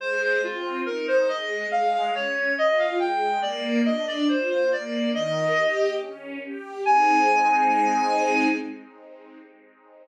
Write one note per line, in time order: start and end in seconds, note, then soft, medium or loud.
0.00 0.38 G#3 loud
0.00 0.21 C5 medium
0.21 0.41 C5 medium
0.43 0.82 C4 medium
0.43 0.81 F4 medium
0.86 1.25 D#4 medium
0.86 1.06 A#4 medium
1.08 1.28 C5 medium
1.29 1.67 G#3 medium
1.29 1.66 D#5 medium
1.71 2.10 G#3 loud
1.71 1.92 F5 medium
1.94 2.14 F5 medium
2.14 2.53 C#4 medium
2.14 2.52 C#5 medium
2.57 2.96 F4 medium
2.57 2.79 D#5 medium
2.79 2.99 F5 medium
2.99 3.38 G#3 medium
2.99 3.41 G5 medium
3.42 3.81 A#3 loud
3.42 3.81 D5 medium
3.85 4.24 D4 loud
3.85 4.06 D#5 medium
4.07 4.28 D5 medium
4.28 4.67 F4 medium
4.28 4.49 C5 medium
4.50 4.70 C5 medium
4.71 5.09 A#3 medium
4.71 5.12 D5 medium
5.14 5.53 D#3 loud
5.14 5.91 D#5 medium
5.57 5.95 G4 medium
6.00 6.39 C#4 medium
6.43 6.82 G4 medium
6.85 8.48 G#3 medium
6.85 8.48 C4 loud
6.85 8.48 D#4 loud
6.85 8.48 G#5 loud